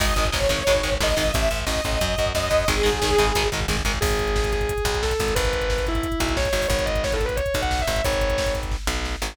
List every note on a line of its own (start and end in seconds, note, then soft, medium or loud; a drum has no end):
0.00 0.14 G#1 loud
0.00 0.06 D#3 loud
0.00 0.06 G#3 loud
0.00 0.27 D#5 medium
0.00 kick loud
0.00 crash loud
0.08 kick medium
0.16 0.30 G#1 medium
0.16 0.25 D#3 medium
0.16 0.25 G#3 medium
0.16 kick medium
0.16 closed hi-hat medium
0.25 kick medium
0.32 0.48 G#1 medium
0.32 0.39 D#3 medium
0.32 0.39 G#3 medium
0.32 0.93 C#5 medium
0.32 kick loud
0.32 snare loud
0.42 kick medium
0.49 0.63 G#1 medium
0.49 0.57 D#3 medium
0.49 0.57 G#3 medium
0.49 kick medium
0.49 closed hi-hat medium
0.59 kick medium
0.67 0.82 G#1 loud
0.67 0.73 D#3 loud
0.67 0.73 G#3 loud
0.67 kick medium
0.67 closed hi-hat medium
0.75 kick medium
0.83 0.98 G#1 medium
0.83 0.90 D#3 medium
0.83 0.90 G#3 medium
0.83 kick medium
0.83 closed hi-hat medium
0.92 kick medium
1.00 1.15 G#1 medium
1.00 1.08 D#3 medium
1.00 1.08 G#3 medium
1.00 1.33 D#5 medium
1.00 kick medium
1.00 snare loud
1.09 kick medium
1.17 1.32 G#1 medium
1.17 1.23 D#3 medium
1.17 1.23 G#3 medium
1.17 kick medium
1.17 open hi-hat medium
1.26 kick medium
1.32 1.49 A1 loud
1.32 1.60 E5 medium
1.32 kick loud
1.32 closed hi-hat loud
1.42 kick medium
1.51 1.65 A1 medium
1.51 kick medium
1.51 closed hi-hat medium
1.59 kick medium
1.66 1.81 A1 medium
1.66 2.29 D#5 medium
1.66 kick medium
1.66 snare loud
1.76 kick medium
1.84 1.99 A1 medium
1.84 kick medium
1.84 closed hi-hat medium
1.93 kick medium
2.01 2.16 F#2 loud
2.01 kick medium
2.01 closed hi-hat loud
2.09 kick medium
2.18 2.33 F#2 medium
2.18 kick medium
2.18 closed hi-hat medium
2.26 kick medium
2.35 2.49 F#2 medium
2.35 2.67 D#5 medium
2.35 kick medium
2.35 snare loud
2.43 kick medium
2.51 2.65 F#2 medium
2.51 kick medium
2.51 closed hi-hat medium
2.60 kick medium
2.68 2.82 G#1 loud
2.68 2.75 D#3 loud
2.68 2.75 G#3 loud
2.68 3.47 G#4 medium
2.68 kick loud
2.68 closed hi-hat medium
2.77 kick medium
2.83 3.00 G#1 medium
2.83 2.90 D#3 medium
2.83 2.90 G#3 loud
2.83 kick medium
2.83 closed hi-hat medium
2.93 kick medium
3.02 3.16 G#1 medium
3.02 3.10 D#3 medium
3.02 3.10 G#3 medium
3.02 kick medium
3.02 snare loud
3.10 kick medium
3.18 3.33 G#1 medium
3.18 3.26 D#3 medium
3.18 3.26 G#3 loud
3.18 kick medium
3.18 closed hi-hat medium
3.27 kick medium
3.35 3.50 G#1 loud
3.35 3.43 D#3 loud
3.35 3.43 G#3 loud
3.35 kick medium
3.35 closed hi-hat loud
3.44 kick medium
3.52 3.66 G#1 medium
3.52 3.60 D#3 medium
3.52 3.60 G#3 medium
3.52 kick medium
3.52 closed hi-hat medium
3.60 kick medium
3.68 3.82 G#1 medium
3.68 3.76 D#3 medium
3.68 3.76 G#3 medium
3.68 kick medium
3.68 snare loud
3.77 kick medium
3.85 3.99 G#1 medium
3.85 3.92 D#3 medium
3.85 3.92 G#3 medium
3.85 kick medium
3.85 closed hi-hat medium
3.94 kick medium
4.01 4.73 G#1 loud
4.01 4.49 G#4 medium
4.01 kick loud
4.01 crash loud
4.11 kick medium
4.11 closed hi-hat medium
4.19 kick medium
4.19 closed hi-hat medium
4.27 kick medium
4.27 closed hi-hat medium
4.36 kick medium
4.36 snare loud
4.44 kick medium
4.44 closed hi-hat medium
4.53 4.97 G#4 medium
4.53 kick medium
4.53 snare medium
4.53 closed hi-hat medium
4.61 kick medium
4.61 closed hi-hat medium
4.69 kick medium
4.69 closed hi-hat loud
4.78 kick medium
4.78 closed hi-hat medium
4.85 5.13 B1 medium
4.85 kick medium
4.85 closed hi-hat medium
4.94 kick medium
4.94 closed hi-hat medium
5.03 5.32 A4 medium
5.03 kick medium
5.03 snare loud
5.11 kick medium
5.11 closed hi-hat medium
5.20 5.34 G#1 medium
5.20 kick medium
5.20 closed hi-hat medium
5.28 kick medium
5.28 closed hi-hat medium
5.35 6.08 G#1 loud
5.35 5.81 B4 medium
5.35 kick loud
5.35 closed hi-hat loud
5.45 kick medium
5.45 closed hi-hat medium
5.53 kick medium
5.53 closed hi-hat medium
5.61 kick medium
5.61 closed hi-hat medium
5.70 kick medium
5.70 snare loud
5.78 kick medium
5.78 closed hi-hat medium
5.87 6.33 E4 medium
5.87 kick medium
5.87 snare medium
5.87 closed hi-hat medium
5.95 kick medium
5.95 closed hi-hat medium
6.03 kick medium
6.03 closed hi-hat loud
6.12 kick medium
6.12 closed hi-hat medium
6.20 6.49 B1 medium
6.20 kick medium
6.20 closed hi-hat medium
6.28 kick medium
6.28 closed hi-hat medium
6.37 6.65 C#5 medium
6.37 kick medium
6.37 snare loud
6.45 kick medium
6.45 closed hi-hat medium
6.53 6.67 G#1 medium
6.53 kick medium
6.53 closed hi-hat medium
6.62 kick medium
6.62 open hi-hat medium
6.69 7.41 G#1 loud
6.69 6.85 C#5 medium
6.69 kick loud
6.69 closed hi-hat medium
6.79 kick medium
6.79 closed hi-hat medium
6.85 7.01 D#5 medium
6.85 kick medium
6.85 closed hi-hat medium
6.96 kick medium
6.96 closed hi-hat medium
7.04 7.14 C#5 medium
7.04 kick medium
7.04 snare loud
7.12 7.24 A4 medium
7.12 kick medium
7.12 closed hi-hat medium
7.21 kick medium
7.21 snare soft
7.21 closed hi-hat medium
7.26 7.36 B4 medium
7.26 kick medium
7.26 closed hi-hat medium
7.36 7.56 C#5 medium
7.36 kick medium
7.36 closed hi-hat loud
7.46 kick medium
7.46 closed hi-hat medium
7.54 7.83 B1 medium
7.54 kick medium
7.54 closed hi-hat medium
7.62 7.81 F#5 medium
7.62 kick medium
7.62 closed hi-hat medium
7.71 kick medium
7.71 snare loud
7.79 8.02 E5 medium
7.79 kick medium
7.79 closed hi-hat medium
7.88 8.02 G#1 medium
7.88 kick medium
7.88 closed hi-hat medium
7.96 kick medium
7.96 closed hi-hat medium
8.04 8.77 G#1 medium
8.04 8.49 C#5 medium
8.04 kick loud
8.04 closed hi-hat loud
8.13 kick medium
8.13 closed hi-hat medium
8.21 kick medium
8.21 closed hi-hat medium
8.30 kick medium
8.30 closed hi-hat medium
8.38 kick medium
8.38 snare loud
8.46 kick medium
8.46 closed hi-hat medium
8.55 kick medium
8.55 snare medium
8.55 closed hi-hat medium
8.63 kick medium
8.63 closed hi-hat medium
8.72 kick medium
8.72 snare medium
8.87 9.16 B1 medium
8.87 snare medium
9.05 snare medium
9.22 9.36 G#1 medium
9.22 snare loud